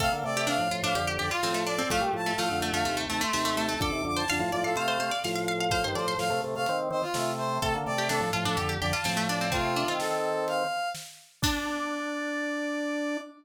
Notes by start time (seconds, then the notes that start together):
0.00 C3 A3 A4 F5, kick, crash
0.12 D3 A#3
0.24 C3 A3 D5
0.37 G4
0.47 C3 A3 D4 F5, snare
0.58 A2 F3
0.71 A2 F3 F4
0.83 A2 F3 D4 F5
0.95 F2 D3 G4, closed hi-hat
1.07 G4
1.18 F2 D3 G4 D5
1.31 F4
1.43 A2 F3 C4, snare
1.54 A3
1.66 D4 D5
1.78 C4
1.90 A2 F3 A3 F5, kick, closed hi-hat
2.01 A#2 G3
2.13 A2 F3 A5
2.26 A3
2.36 A2 F3 A3 F5, snare
2.51 F2 D3
2.60 F2 D3 A3
2.72 F2 D3 A3 F5
2.85 D#2 C3 A3, closed hi-hat
2.97 A3
3.09 D#2 C3 A3 A5
3.21 A3 C6
3.33 D#2 C3 A3, snare
3.45 A3
3.57 A3 A5
3.69 A3
3.80 F2 D3 A4 D6, kick, closed hi-hat
3.91 D#2 C3
4.04 F2 D3 D6
4.16 C5 A5
4.28 F2 D3 F5 A5, snare
4.40 A2 F3
4.51 A2 F3 D5
4.63 A2 F3 A4 F5
4.76 C3 A3 C5 F5, closed hi-hat
4.88 C5
4.99 C3 A3 C5
5.11 D5
5.24 A2 F3 F5, snare
5.35 F5
5.48 F5
5.60 F5
5.70 A2 F3 C5 F5, kick, closed hi-hat
5.84 G2 D#3 C5
5.95 A2 F3 C5 D5
6.08 C5
6.18 A2 F3 F5, snare
6.30 C3 A3
6.44 C3 A3
6.55 C3 A3 F5
6.66 D#3 C4, closed hi-hat
6.90 D#3 C4 C5
7.02 F4
7.14 C3 A3, snare
7.38 C5
7.62 C3 A3 A4, kick, closed hi-hat
7.74 D3 A#3
7.86 C3 A3 D5
7.98 G4
8.09 C3 A3 D4 A4, snare
8.20 A2 F3
8.33 A2 F3 F4
8.45 A2 F3 D4 A4
8.57 F2 D3 G4, closed hi-hat
8.69 G4
8.81 F2 D3 G4 D5
8.93 F4 A5
9.04 A2 F3 C4, snare
9.17 A3
9.29 D4 D5
9.41 C4
9.52 C3 A3 C4 F4, kick, closed hi-hat
9.76 D4
9.88 D#3 C4 F4
9.99 A4, snare
10.48 F5, closed hi-hat
10.95 snare
11.42 D4 D5, kick, crash